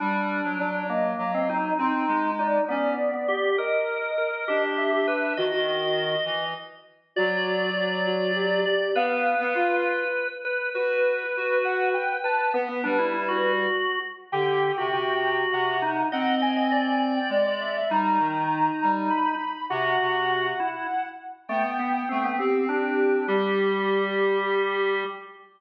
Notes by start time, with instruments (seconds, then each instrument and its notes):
0.00 clarinet G3, drawbar organ D4, ocarina B5
0.44 clarinet F#3
0.59 clarinet F#3, drawbar organ D4, ocarina D5
0.89 drawbar organ A#3, ocarina D#5
1.18 clarinet F#3
1.34 drawbar organ C4
1.49 drawbar organ D#4
1.79 clarinet C4, drawbar organ D#4, ocarina C6
2.08 clarinet G#3
2.39 drawbar organ D#4, ocarina D5
2.68 drawbar organ B3, clarinet C#4, ocarina D5
3.14 drawbar organ B3
3.28 drawbar organ G4
3.58 drawbar organ A#4, ocarina D#5
4.18 drawbar organ A#4
4.48 clarinet D4, drawbar organ G4
4.77 ocarina E5
4.93 drawbar organ G4
5.07 drawbar organ B4
5.37 clarinet D#3, ocarina F#4, drawbar organ D#5
5.52 ocarina F#4
6.25 clarinet E3
7.16 clarinet F#3, ocarina F#4, drawbar organ D5
7.76 ocarina F#4
8.07 ocarina F#4
8.35 ocarina G4
8.66 ocarina G4, drawbar organ D5
8.95 clarinet B3, drawbar organ B4, ocarina F5
9.40 clarinet B3
9.55 clarinet F4
10.45 drawbar organ B4
10.74 clarinet F#4, ocarina B4, drawbar organ B4
11.37 clarinet F#4
11.64 ocarina F#5
11.94 ocarina G5
12.24 drawbar organ B4, ocarina A5
12.54 drawbar organ B3, clarinet B3, ocarina B4
12.69 drawbar organ B3
12.84 clarinet G3, drawbar organ D4
12.99 drawbar organ E4
13.13 drawbar organ E4
13.28 drawbar organ F#4
14.32 clarinet D3, drawbar organ G4, ocarina G5
14.78 clarinet C3, drawbar organ F#4
14.92 clarinet C3, drawbar organ F#4
15.52 clarinet C3, ocarina F#5
15.82 drawbar organ D#4
16.12 clarinet C4, drawbar organ D#5, ocarina F#5
16.42 drawbar organ D#5, ocarina G#5
16.57 drawbar organ D#5
16.72 drawbar organ D5
17.16 ocarina G5
17.29 clarinet G#3, ocarina D5
17.46 ocarina D5
17.60 ocarina E5
17.77 ocarina E5
17.89 clarinet G3, drawbar organ D#4, ocarina A#5
18.19 clarinet D#3
18.83 clarinet G3
19.10 ocarina B5
19.70 clarinet C3, drawbar organ F#4, ocarina F#5
20.01 clarinet C3
20.60 drawbar organ E4
21.48 drawbar organ A3, clarinet B3, ocarina G5
21.79 drawbar organ B3
22.09 clarinet A3, drawbar organ C4
22.24 drawbar organ B3
22.39 drawbar organ C4, clarinet C4, ocarina G4
22.69 drawbar organ D4, ocarina G4
23.27 clarinet G3, ocarina G4, drawbar organ G4